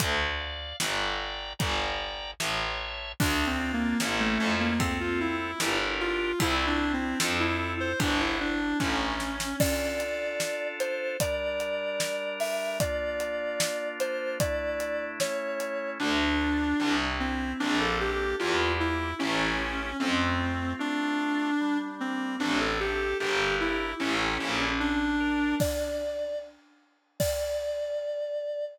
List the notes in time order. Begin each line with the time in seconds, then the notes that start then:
0.00 D2 D5, kick, closed hi-hat
0.40 F5
0.80 G1 D5 G5 A#5, snare
1.59 G1 D5 G5 A#5, kick, closed hi-hat
2.40 A1 C#5 E5 A5, snare
3.20 D2 D4, kick, crash
3.47 C4
3.60 F4
3.73 A#3
4.00 A1 C#4 E4 A4, snare
4.20 A3
4.40 F2
4.60 A#3
4.79 C4 F4 A4, kick, ride
5.00 F4
5.20 E4
5.60 G1 D4 G4 A#4, snare
6.00 F4
6.39 C2 C4 E4, kick, ride
6.67 D4
6.80 E4
6.93 C4
7.20 F2 C4 F4 A4, snare
7.40 E4
7.80 C5
8.00 G1 D4, kick, ride
8.20 E4
8.40 D4
8.80 A1 C#4, kick, snare
9.20 snare
9.40 snare
9.60 D4 F4 A4 D5, kick, crash
10.00 closed hi-hat
10.40 snare
10.80 C5, closed hi-hat
11.20 G3 D4 A#4 D5, kick, closed hi-hat
11.60 closed hi-hat
12.00 snare
12.40 E5, open hi-hat
12.80 A#3 D4 F4 D5, kick, closed hi-hat
13.20 closed hi-hat
13.60 snare
14.00 C5, closed hi-hat
14.40 A3 D4 E4 D5, kick, closed hi-hat
14.80 closed hi-hat
15.20 A3 C#4 E4 C#5, snare
15.60 closed hi-hat
16.00 D2 D4
16.40 F4
16.80 C2 C4
17.20 C4 E4
17.60 A#1 A#3 D4
17.80 A4
18.00 D4 G4
18.39 E2 A#3 E4 F4 G4
18.80 E4
19.19 A1 A3 C#4 E4 G4
19.99 F2 A3 C4
20.40 F4
20.79 A3 D4 F4
21.61 G3
22.00 A#3 C4
22.39 A1 C4 D4
22.60 A4
22.80 G4 A4
23.20 G1 D4 G4 A#4
23.60 E4
24.00 A1 C#4 E4 G4 A4
24.40 A#1
24.80 D4
25.20 A#4
25.60 D5, kick, crash
27.20 D5, kick, crash